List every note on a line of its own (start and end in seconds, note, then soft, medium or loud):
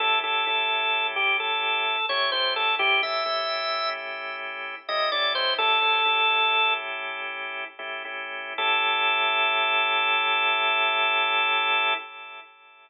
0.00 0.22 A3 medium
0.00 0.22 C#4 medium
0.00 0.22 E4 medium
0.00 0.22 G4 medium
0.00 0.19 A4 loud
0.23 0.45 A3 medium
0.23 0.45 C#4 medium
0.23 0.45 E4 medium
0.23 0.45 G4 medium
0.23 1.07 A4 medium
0.47 1.96 A3 medium
0.47 1.96 C#4 medium
0.47 1.96 E4 medium
0.47 1.96 G4 medium
1.16 1.37 G4 medium
1.40 2.06 A4 medium
2.09 2.31 A3 medium
2.09 2.31 C#4 medium
2.09 2.31 E4 medium
2.09 2.31 G4 medium
2.09 2.30 C#5 loud
2.32 2.75 A3 medium
2.32 2.75 C#4 medium
2.32 2.75 E4 medium
2.32 2.75 G4 medium
2.32 2.54 C5 loud
2.56 2.75 A4 loud
2.79 3.00 A3 medium
2.79 3.00 C#4 medium
2.79 3.00 E4 loud
2.79 3.01 G4 loud
3.02 3.24 A3 medium
3.02 3.24 C#4 medium
3.02 3.24 E4 medium
3.02 3.24 G4 medium
3.02 3.90 E5 medium
3.25 4.75 A3 medium
3.25 4.75 C#4 medium
3.25 4.75 E4 medium
3.25 4.75 G4 medium
4.88 5.10 A3 medium
4.88 5.10 C#4 medium
4.88 5.10 E4 medium
4.88 5.10 G4 medium
4.88 5.10 D#5 medium
5.12 5.54 A3 medium
5.12 5.54 C#4 medium
5.12 5.54 E4 medium
5.12 5.54 G4 medium
5.12 5.33 D5 loud
5.35 5.54 C5 loud
5.58 5.80 A3 medium
5.58 5.80 C#4 medium
5.58 5.80 E4 medium
5.58 5.80 G4 medium
5.58 6.74 A4 loud
5.82 6.03 A3 medium
5.82 6.03 C#4 medium
5.82 6.03 E4 medium
5.82 6.03 G4 medium
6.05 7.64 A3 medium
6.05 7.64 C#4 medium
6.05 7.64 E4 medium
6.05 7.64 G4 medium
7.79 8.03 A3 medium
7.79 8.03 C#4 medium
7.79 8.03 E4 medium
7.79 8.03 G4 medium
8.05 8.54 A3 medium
8.05 8.54 C#4 medium
8.05 8.54 E4 medium
8.05 8.54 G4 medium
8.58 11.94 A3 loud
8.58 11.94 C#4 loud
8.58 11.94 E4 loud
8.58 11.94 G4 loud
8.58 11.94 A4 loud